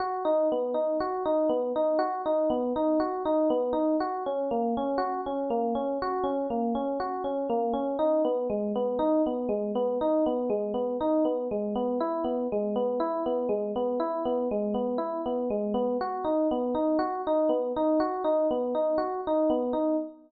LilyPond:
\new Staff { \time 4/4 \key b \major \tempo 4 = 60 fis'16 dis'16 b16 dis'16 fis'16 dis'16 b16 dis'16 fis'16 dis'16 b16 dis'16 fis'16 dis'16 b16 dis'16 | fis'16 cis'16 ais16 cis'16 fis'16 cis'16 ais16 cis'16 fis'16 cis'16 ais16 cis'16 fis'16 cis'16 ais16 cis'16 | dis'16 b16 gis16 b16 dis'16 b16 gis16 b16 dis'16 b16 gis16 b16 dis'16 b16 gis16 b16 | e'16 b16 gis16 b16 e'16 b16 gis16 b16 e'16 b16 gis16 b16 e'16 b16 gis16 b16 |
fis'16 dis'16 b16 dis'16 fis'16 dis'16 b16 dis'16 fis'16 dis'16 b16 dis'16 fis'16 dis'16 b16 dis'16 | }